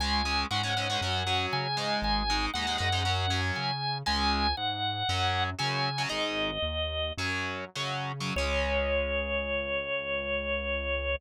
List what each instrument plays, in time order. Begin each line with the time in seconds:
0.00 synth bass 1 C#2, overdriven guitar G#3 C#4, drawbar organ G#5
0.25 overdriven guitar G#3 C#4
0.51 synth bass 1 G#2, overdriven guitar G#3 C#4, drawbar organ F#5
0.63 overdriven guitar G#3 C#4
0.77 overdriven guitar G#3 C#4
0.90 overdriven guitar G#3 C#4
1.01 synth bass 1 F#2, overdriven guitar F#3 C#4
1.27 overdriven guitar F#3 C#4
1.53 synth bass 1 C#3, drawbar organ G#5
1.77 overdriven guitar G#3 D#4
2.02 synth bass 1 G#1, drawbar organ G#5
2.30 overdriven guitar G#3 D#4
2.54 synth bass 1 D#2, overdriven guitar G#3 D#4, drawbar organ F#5
2.67 overdriven guitar G#3 D#4
2.78 synth bass 1 F#2, overdriven guitar G#3 D#4
2.92 overdriven guitar G#3 D#4
3.05 overdriven guitar F#3 C#4
3.30 overdriven guitar F#3 C#4
3.56 synth bass 1 C#3, drawbar organ G#5
4.06 synth bass 1 C#2, overdriven guitar G#3 C#4, drawbar organ G#5
4.57 synth bass 1 G#2, drawbar organ F#5
5.09 synth bass 1 F#2, overdriven guitar F#3 C#4
5.59 synth bass 1 C#3, overdriven guitar F#3 C#4, drawbar organ G#5
5.98 overdriven guitar F#3 C#4
6.09 synth bass 1 G#1, overdriven guitar G#3 D#4, drawbar organ D#5
6.62 synth bass 1 D#2
7.17 synth bass 1 F#2, overdriven guitar F#3 C#4
7.75 synth bass 1 C#3, overdriven guitar F#3 C#4
8.20 overdriven guitar F#3 C#4
8.36 synth bass 1 C#2, overdriven guitar G#3 C#4, drawbar organ C#5